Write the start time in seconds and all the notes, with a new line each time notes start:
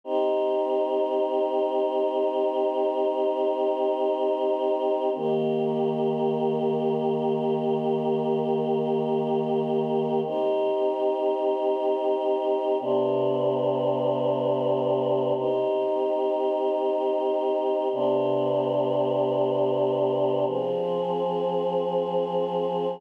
0.04 C4 D#4 G4
5.15 D#3 A#3 G4
10.25 C4 D#4 G4
12.80 C3 B3 D4 G4
15.36 C4 D#4 G4
17.92 C3 B3 D4 G4
20.46 F3 C4 G#4